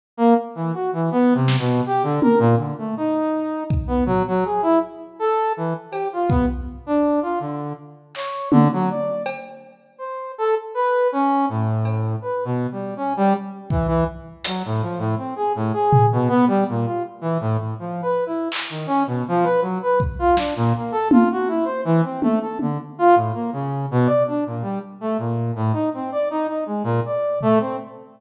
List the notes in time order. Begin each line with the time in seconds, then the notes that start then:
0.17 A#3
0.55 E3
0.74 F#4
0.93 E3
1.12 B3
1.34 C3
1.48 snare
1.59 B2
1.86 G4
2.03 D3
2.22 A#4, high tom
2.39 A#2
2.57 D3
2.78 A3
2.97 D#4
3.70 kick
3.87 B3
4.06 F#3, floor tom
4.27 F#3
4.45 G#4
4.62 E4
5.19 A4
5.57 E3
5.91 G4, cowbell
6.13 F4
6.29 B3, kick
6.86 D4
7.22 F4
7.40 D3
8.15 C#5, clap
8.51 D3, high tom
8.73 F#3
8.90 D5
9.26 cowbell
9.98 C5
10.38 A4
10.74 B4
11.12 C#4
11.49 A2
11.85 cowbell
12.22 B4
12.45 B2
12.72 G3
12.97 C#4
13.17 G3
13.70 E3, kick
13.88 E3
14.44 F#3, closed hi-hat
14.65 A2
14.82 F3
14.98 A2
15.18 C4
15.36 G#4
15.55 A2
15.73 G#4
15.93 floor tom
16.12 B2
16.29 B3
16.47 G3
16.69 A#2
16.86 F4
17.21 E3
17.40 A2
17.58 A2
17.79 F3
18.02 B4
18.26 E4
18.52 clap
18.70 D#3
18.87 C#4
19.07 B2
19.28 F3
19.44 B4
19.62 F#3
19.82 B4
20.00 kick
20.19 F4
20.37 D4, snare
20.56 A#2
20.76 A#3
20.92 A4
21.11 F4, high tom
21.32 F#4
21.48 E4
21.65 C5
21.85 E3
22.04 C4
22.22 A3, high tom
22.41 A4
22.59 D3, high tom
22.99 F4
23.15 A2
23.34 A#3
23.53 C#3
23.91 B2
24.06 D5
24.27 D4
24.46 A#2
24.62 G3
25.01 A3
25.18 A#2
25.56 A2
25.73 D#4
25.94 C4
26.12 D5
26.30 D#4
26.48 D#4
26.66 G#3
26.84 A#2
27.06 D5
27.41 A3, floor tom
27.60 C4